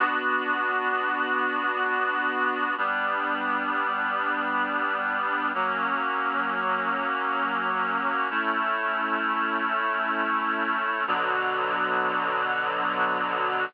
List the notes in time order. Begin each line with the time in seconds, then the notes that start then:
0.00 B3 D4 F#4
2.78 G3 B3 D4
5.54 F#3 A#3 C#4
8.30 A3 C#4 E4
11.07 B2 D3 F#3